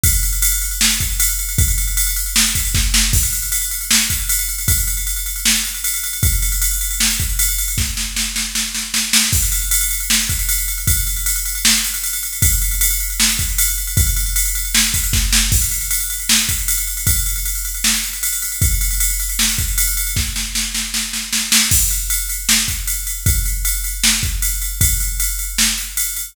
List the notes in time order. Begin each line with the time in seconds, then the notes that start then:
0.04 kick, ride
0.13 ride
0.23 ride
0.33 ride
0.42 ride
0.52 ride
0.62 ride
0.71 ride
0.81 snare
0.91 ride
1.00 kick, ride
1.10 ride
1.20 ride
1.29 ride
1.39 ride
1.49 ride
1.58 kick, ride
1.68 ride
1.78 ride
1.87 ride
1.97 ride
2.07 ride
2.16 ride
2.26 ride
2.36 snare
2.45 ride
2.55 kick, ride
2.65 ride
2.75 kick, snare
2.94 snare
3.13 kick, crash
3.23 ride
3.33 ride
3.42 ride
3.52 ride
3.62 ride
3.71 ride
3.81 ride
3.91 snare
4.00 ride
4.10 kick, ride
4.20 ride
4.29 ride
4.39 ride
4.49 ride
4.58 ride
4.68 kick, ride
4.78 ride
4.87 ride
4.97 ride
5.07 ride
5.16 ride
5.26 ride
5.36 ride
5.45 snare
5.55 ride
5.65 ride
5.75 ride
5.84 ride
5.94 ride
6.04 ride
6.13 ride
6.23 kick, ride
6.33 ride
6.42 ride
6.52 ride
6.62 ride
6.71 ride
6.81 ride
6.91 ride
7.00 snare
7.10 ride
7.20 kick, ride
7.29 ride
7.39 ride
7.49 ride
7.58 ride
7.68 ride
7.78 kick, snare
7.97 snare
8.16 snare
8.36 snare
8.55 snare
8.75 snare
8.94 snare
9.13 snare
9.33 kick, crash
9.42 ride
9.52 ride
9.62 ride
9.71 ride
9.81 ride
9.91 ride
10.00 ride
10.10 snare
10.20 ride
10.29 kick, ride
10.39 ride
10.49 ride
10.58 ride
10.68 ride
10.78 ride
10.87 kick, ride
10.97 ride
11.07 ride
11.16 ride
11.26 ride
11.36 ride
11.45 ride
11.55 ride
11.65 snare
11.75 ride
11.84 ride
11.94 ride
12.04 ride
12.13 ride
12.23 ride
12.33 ride
12.42 kick, ride
12.52 ride
12.62 ride
12.71 ride
12.81 ride
12.91 ride
13.00 ride
13.10 ride
13.20 snare
13.29 ride
13.39 kick, ride
13.49 ride
13.58 ride
13.68 ride
13.78 ride
13.87 ride
13.97 kick, ride
14.07 ride
14.16 ride
14.26 ride
14.36 ride
14.45 ride
14.55 ride
14.65 ride
14.75 snare
14.84 ride
14.94 kick, ride
15.04 ride
15.13 kick, snare
15.33 snare
15.52 kick, crash
15.62 ride
15.71 ride
15.81 ride
15.91 ride
16.00 ride
16.10 ride
16.20 ride
16.29 snare
16.39 ride
16.49 kick, ride
16.58 ride
16.68 ride
16.78 ride
16.87 ride
16.97 ride
17.07 kick, ride
17.16 ride
17.26 ride
17.36 ride
17.45 ride
17.55 ride
17.65 ride
17.75 ride
17.84 snare
17.94 ride
18.04 ride
18.13 ride
18.23 ride
18.33 ride
18.42 ride
18.52 ride
18.62 kick, ride
18.71 ride
18.81 ride
18.91 ride
19.00 ride
19.10 ride
19.20 ride
19.29 ride
19.39 snare
19.49 ride
19.58 kick, ride
19.68 ride
19.78 ride
19.87 ride
19.97 ride
20.07 ride
20.16 kick, snare
20.36 snare
20.55 snare
20.75 snare
20.94 snare
21.13 snare
21.33 snare
21.52 snare
21.71 kick, crash
21.91 ride
22.10 ride
22.29 ride
22.49 snare
22.68 kick, ride
22.87 ride
23.07 ride
23.26 kick, ride
23.45 ride
23.65 ride
23.84 ride
24.04 snare
24.23 kick, ride
24.42 ride
24.62 ride
24.81 kick, ride
25.00 ride
25.20 ride
25.39 ride
25.58 snare
25.78 ride
25.97 ride
26.16 ride